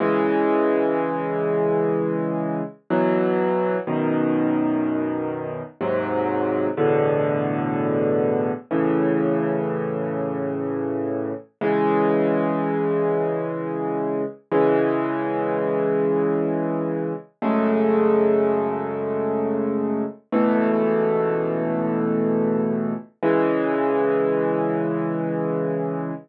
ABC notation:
X:1
M:3/4
L:1/8
Q:1/4=62
K:C#m
V:1 name="Acoustic Grand Piano"
[C,E,G,]6 | [B,,E,F,]2 [F,,B,,D,]4 | [D,,G,,^B,,F,]2 [E,,A,,=B,,=D,]4 | [A,,C,E,]6 |
[C,E,G,]6 | [C,E,G,]6 | [F,,C,G,A,]6 | [C,,B,,E,A,]6 |
[C,E,G,]6 |]